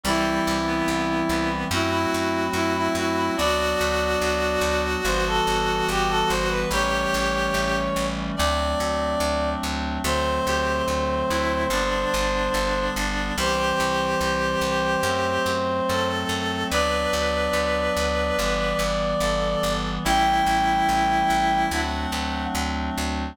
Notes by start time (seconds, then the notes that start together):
0.03 C2 E3 G3 C4 E4
0.47 C2
0.67 B3
0.88 C2
1.29 C2 B3
1.71 F#2 F#3 A3 C4 E4 F#4
1.91 E4
2.14 F#2
2.53 F#2 E4
2.76 E4
2.95 F#2 E4 F#4
3.17 E4
3.36 D2 F#3 B3 D4 F#4 D5
3.81 D2
4.22 D2
4.61 D2
5.05 G1 E3 G3 B3 C5
5.27 A4
5.47 G1
5.88 G1 G4
6.09 A4
6.28 G1 C5
6.49 B4
6.71 A1 E3 G3 A3 C#4 G4 C#5
7.14 A1
7.54 A1
7.96 A1
8.36 D2 F#3 A3 C4 D4 D5
8.80 D2
9.20 D2
9.63 D2
10.04 D2 D3 F#3 A3 C4 C5
10.46 D2 G4
10.88 D2
11.30 D2 E4
11.70 G1 D3 G3 B3 D4
12.14 G1
12.54 G1
12.96 G1
13.36 C2 E3 G3 C4 G4 C5
13.80 C2
14.21 C2
14.61 C2
15.03 F#2 F#3 A3 C4
15.46 F#2
15.88 F#2 A4
16.29 F#2
16.70 D2 F#3 B3 D4 B4 D5
17.13 D2
17.53 D2
17.97 D2
18.39 G1 E3 G3 B3
18.79 G1
19.20 G1 A4
19.63 G1
20.04 A1 E3 G3 A3 C#4 E4 G5
20.47 A1
20.89 A1
21.30 A1
21.71 D2 F#3 A3 C4 D4 F#5
22.12 D2
22.55 D2
22.98 D2